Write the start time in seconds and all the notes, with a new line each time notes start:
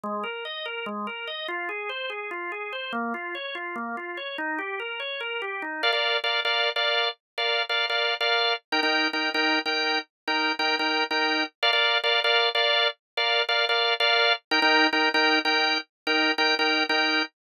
0.04 G#3
0.24 A#4
0.45 D#5
0.66 A#4
0.86 G#3
1.07 A#4
1.27 D#5
1.48 F4
1.69 G#4
1.89 C5
2.10 G#4
2.31 F4
2.52 G#4
2.73 C5
2.93 A#3
3.14 F4
3.35 C#5
3.55 F4
3.76 A#3
3.97 F4
4.17 C#5
4.38 D#4
4.59 G4
4.80 A#4
5.00 C#5
5.21 A#4
5.42 G4
5.62 D#4
5.83 A#4 D5 F5
5.93 A#4 D5 F5
6.24 A#4 D5 F5
6.45 A#4 D5 F5
6.76 A#4 D5 F5
7.38 A#4 D5 F5
7.69 A#4 D5 F5
7.90 A#4 D5 F5
8.21 A#4 D5 F5
8.72 D#4 A#4 G5
8.83 D#4 A#4 G5
9.13 D#4 A#4 G5
9.34 D#4 A#4 G5
9.66 D#4 A#4 G5
10.27 D#4 A#4 G5
10.59 D#4 A#4 G5
10.79 D#4 A#4 G5
11.11 D#4 A#4 G5
11.63 A#4 D5 F5
11.73 A#4 D5 F5
12.04 A#4 D5 F5
12.24 A#4 D5 F5
12.55 A#4 D5 F5
13.17 A#4 D5 F5
13.49 A#4 D5 F5
13.69 A#4 D5 F5
14.00 A#4 D5 F5
14.51 D#4 A#4 G5
14.62 D#4 A#4 G5
14.93 D#4 A#4 G5
15.14 D#4 A#4 G5
15.45 D#4 A#4 G5
16.07 D#4 A#4 G5
16.38 D#4 A#4 G5
16.59 D#4 A#4 G5
16.89 D#4 A#4 G5